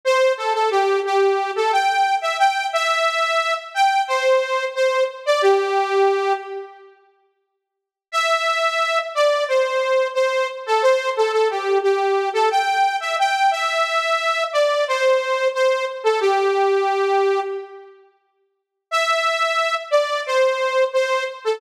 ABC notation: X:1
M:4/4
L:1/16
Q:1/4=89
K:C
V:1 name="Lead 2 (sawtooth)"
c2 A A G2 G3 A g3 e g2 | e6 g2 c4 c2 z d | G6 z10 | e6 d2 c4 c2 z A |
c2 A A G2 G3 A g3 e g2 | e6 d2 c4 c2 z A | G8 z8 | e6 d2 c4 c2 z A |]